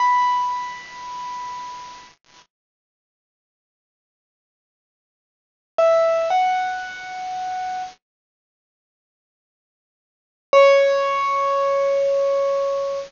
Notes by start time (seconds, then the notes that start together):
0.00 B5
5.78 E5
6.30 F#5
10.53 C#5